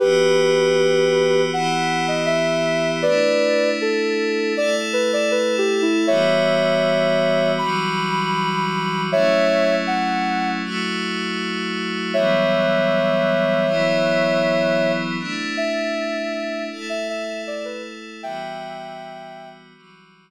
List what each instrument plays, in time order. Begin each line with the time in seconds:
0.00 pad 5 (bowed) E3 B3 F#4 G4, ocarina G4 B4
1.52 pad 5 (bowed) E3 B3 E4 G4, ocarina F#5
2.08 ocarina D#5
2.26 ocarina E5
3.02 pad 5 (bowed) A3 D4 E4, ocarina B4 D5
3.81 ocarina A4
4.56 pad 5 (bowed) A3 E4 A4, ocarina D5
4.93 ocarina B4
5.13 ocarina D5
5.31 ocarina B4
5.58 ocarina G4
5.82 ocarina E4
6.07 pad 5 (bowed) E3 G3 B3 F#4, ocarina C#5 E5
7.58 pad 5 (bowed) E3 F#3 G3 F#4, ocarina B5
9.12 pad 5 (bowed) F#3 A3 C#4 E4, ocarina C#5 E5
9.87 ocarina F#5
10.63 pad 5 (bowed) F#3 A3 E4 F#4
12.14 pad 5 (bowed) E3 F#3 G3 B3, ocarina C#5 E5
13.67 pad 5 (bowed) E3 F#3 B3 E4
15.19 pad 5 (bowed) A3 D4 E4
15.57 ocarina E5
16.71 pad 5 (bowed) A3 E4 A4
16.89 ocarina E5
17.09 ocarina E5
17.47 ocarina D5
17.65 ocarina B4
18.23 pad 5 (bowed) E3 G3 B3 F#4, ocarina E5 G5
19.75 pad 5 (bowed) E3 F#3 G3 F#4